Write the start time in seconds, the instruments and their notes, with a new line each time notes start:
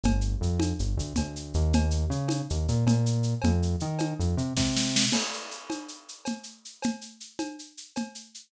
0.04 synth bass 1 G1, cowbell, low conga, shaker
0.21 shaker
0.41 synth bass 1 F2, shaker
0.60 cowbell, high conga, shaker
0.79 synth bass 1 G1, shaker
0.97 synth bass 1 D2, shaker
1.15 synth bass 1 D2, cowbell, low conga, shaker
1.36 shaker
1.54 synth bass 1 D#2, shaker
1.73 cowbell, low conga, shaker
1.91 shaker
2.10 synth bass 1 C#3, shaker
2.28 cowbell, high conga, shaker
2.50 synth bass 1 D#2, shaker
2.68 synth bass 1 A#2, shaker
2.86 synth bass 1 A#2, cowbell, low conga, shaker
3.06 shaker
3.23 shaker
3.42 synth bass 1 F2, cowbell, low conga, shaker
3.62 shaker
3.80 synth bass 1 D#3, shaker
3.99 cowbell, high conga, shaker
4.19 synth bass 1 F2, shaker
4.37 synth bass 1 C3, shaker
4.57 synth bass 1 C3, kick, snare
4.76 snare
4.96 snare
5.12 crash, cowbell, low conga, shaker
5.33 shaker
5.51 shaker
5.70 cowbell, high conga, shaker
5.88 shaker
6.08 shaker
6.25 cowbell, low conga, shaker
6.43 shaker
6.65 shaker
6.82 cowbell, low conga, shaker
7.01 shaker
7.20 shaker
7.39 cowbell, high conga, shaker
7.59 shaker
7.77 shaker
7.96 cowbell, low conga, shaker
8.15 shaker
8.34 shaker